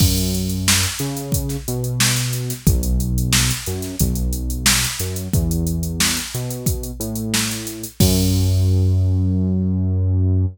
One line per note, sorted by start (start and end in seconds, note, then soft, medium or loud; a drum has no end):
0.00 0.86 F#2 medium
0.00 kick loud
0.00 crash loud
0.18 closed hi-hat medium
0.34 closed hi-hat medium
0.49 closed hi-hat medium
0.68 snare loud
0.84 closed hi-hat medium
0.99 1.57 C#3 medium
0.99 snare soft
0.99 closed hi-hat medium
1.17 closed hi-hat medium
1.32 kick medium
1.32 closed hi-hat loud
1.49 snare soft
1.49 closed hi-hat medium
1.68 2.53 B2 medium
1.68 closed hi-hat medium
1.84 closed hi-hat medium
2.00 snare loud
2.16 snare soft
2.16 closed hi-hat medium
2.33 closed hi-hat medium
2.50 snare soft
2.50 closed hi-hat medium
2.67 3.52 B1 medium
2.67 kick loud
2.67 closed hi-hat loud
2.83 closed hi-hat medium
3.00 closed hi-hat medium
3.18 closed hi-hat medium
3.33 snare loud
3.51 closed hi-hat medium
3.66 3.96 F#2 medium
3.66 closed hi-hat medium
3.82 snare soft
3.82 closed hi-hat medium
3.99 4.86 B1 medium
3.99 kick medium
3.99 closed hi-hat loud
4.15 closed hi-hat medium
4.33 closed hi-hat medium
4.50 closed hi-hat medium
4.66 snare loud
4.84 closed hi-hat medium
4.99 5.28 F#2 medium
4.99 closed hi-hat medium
5.16 closed hi-hat medium
5.33 6.19 E2 medium
5.33 kick loud
5.33 closed hi-hat medium
5.51 closed hi-hat medium
5.67 closed hi-hat medium
5.83 closed hi-hat medium
6.00 snare loud
6.17 closed hi-hat medium
6.34 6.91 B2 medium
6.34 closed hi-hat medium
6.51 closed hi-hat medium
6.66 kick loud
6.66 closed hi-hat loud
6.83 closed hi-hat medium
7.00 7.85 A2 medium
7.00 closed hi-hat medium
7.16 closed hi-hat medium
7.34 snare loud
7.51 closed hi-hat medium
7.67 closed hi-hat medium
7.83 closed hi-hat medium
8.00 10.46 F#2 loud
8.00 kick loud
8.00 crash loud